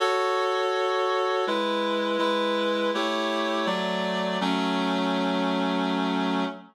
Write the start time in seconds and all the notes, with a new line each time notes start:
0.00 F#4 A4 C#5
1.47 G#3 E4 B4
2.18 G#3 E4 B4
2.94 A3 E4 G4 C#5
3.66 F#3 A3 D5
4.41 F#3 A3 C#4